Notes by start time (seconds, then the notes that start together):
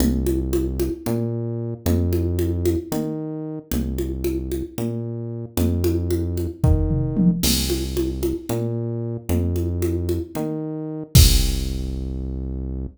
0.00 C2, low conga
0.27 high conga
0.53 high conga
0.80 high conga
1.06 A#2, low conga
1.86 F2, low conga
2.13 high conga
2.39 high conga
2.65 high conga
2.92 D#3, low conga
3.72 C2, low conga
3.98 high conga
4.24 high conga
4.52 high conga
4.78 A#2, low conga
5.57 F2, low conga
5.84 high conga
6.11 high conga
6.37 high conga
6.63 D#3, kick, floor tom
6.90 mid tom
7.17 high tom
7.43 C2, crash, low conga
7.70 high conga
7.97 high conga
8.23 high conga
8.49 A#2, low conga
9.29 F2, low conga
9.56 high conga
9.82 high conga
10.09 high conga
10.35 D#3, low conga
11.15 C2, kick, crash